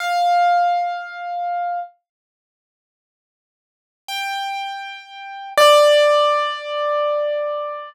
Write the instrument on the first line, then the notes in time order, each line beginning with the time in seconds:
acoustic grand piano
0.00 F5
4.08 G5
5.57 D5